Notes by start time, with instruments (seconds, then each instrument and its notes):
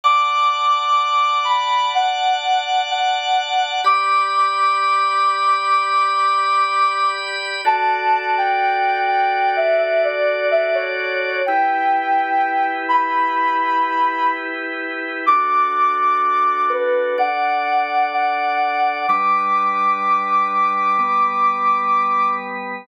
0.04 drawbar organ D5 F#5 A5, ocarina D6
1.45 ocarina B5
1.95 ocarina F#5
2.90 ocarina F#5
3.84 drawbar organ G4 D5 B5, ocarina D6
7.65 drawbar organ F#4 A4 D5, ocarina A5
8.38 ocarina G5
9.08 ocarina G5
9.56 ocarina E5
9.79 ocarina E5
10.04 ocarina D5
10.51 ocarina E5
10.74 ocarina C#5
11.46 drawbar organ E4 G4 B4, ocarina G5
12.89 ocarina B5
15.26 drawbar organ D4 F#4 A4, ocarina D6
16.69 ocarina B4
17.18 drawbar organ D4 A4 D5, ocarina F#5
18.13 ocarina F#5
19.08 drawbar organ G3 D4 B4, ocarina D6
20.99 drawbar organ G3 B3 B4